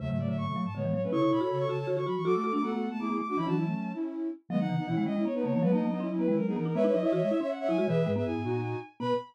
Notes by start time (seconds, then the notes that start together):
0.00 E2 C#3 F#3 A3 E5
0.09 G#2 C#3 E5
0.19 C#3 F#3 A3 D5
0.28 A2 D3 E5
0.37 G#2 F#3 A3 C#6
0.47 B2 F#3 A3
0.56 F#3
0.65 G#2 A5
0.75 A2 D3 G#3 B3 C#5
0.84 E3 G#3 B3
0.93 F#3 C#5
1.03 A3 C#4 B4
1.12 C#3 E4 A4 C#5 C#6
1.21 C#3 E4 C#6
1.31 B2 E4 A4 C#5 B5
1.41 F#4 B5
1.50 C#3 A4 C#5
1.59 C#6
1.69 C#3 F#4 A5
1.79 A5
1.87 D3 F#4
1.96 D3 F#4 C#6
2.06 F#3 F#4 B5
2.16 E3 C#6
2.25 F#3 F#4 A4 D6
2.34 A3 D6
2.44 F#4 A4 D6
2.53 A3 D4 D6
2.62 A3 B3 F#4 A4 F#5
2.72 A3 B3 F#4 A4
2.91 A3 A5
3.00 A3 B3 E4 G#4 D6
3.09 B3 E4 G#4
3.19 A3 D6
3.28 D4 F#4 D6
3.37 E3 C#4 E4 B5
3.47 E3 F#3 D4 F#4 A5
3.56 F#3 C#4 E4
3.65 A3 C#4
3.94 C#4 E4
4.49 D#3 F#3 G#3 B3 D#5
4.59 B3 D#4 F#5
4.69 C#3 E3
4.78 B3 D#4
4.87 B2 E3 C#4 E4
4.96 D#3 G#3 C#4 E4
5.06 G#3 D#5
5.16 G#3 C#4 E4
5.25 B3 C#5
5.34 B3 D#4 B4
5.44 C#3 A#3 C#5
5.53 E3 A#3 C#5
5.62 F#3 G#3 B3 B4
5.72 A#3 B3 D#4 D#5
5.81 F#3 A#3
5.90 F#3 B3 D#4
6.00 C#4 E4
6.09 F#3 C#4 E4
6.19 F#3 B3 B4
6.28 D#3 G#3 C#4 E4
6.37 F#3 A#4
6.47 B3 D#4 G#4
6.56 E3 B3 A#4
6.65 D#4 A#4
6.75 G#3 B3 B4 C#5 E5
6.84 D#4 B4 C#5 E5
6.93 F#3 D#4 D#5
7.03 E4 C#5 E5
7.12 E3 F#4 C#5 E5
7.21 G#3 C#5 E5
7.31 E4 E5
7.41 C#4 C#5 E5
7.50 F#5
7.59 C#5 E5 F#5
7.68 F#3 E4 G#5
7.78 G#3 F#4 G#5
7.88 B2 E3 G#4 B4 E5
8.06 G#2 G#3
8.15 B3 G#4 B4 E5
8.25 F#2 E4 G#4 G#5
8.35 G#2
8.44 A#2 D#4 F#4
9.00 B2 B3 B4 B5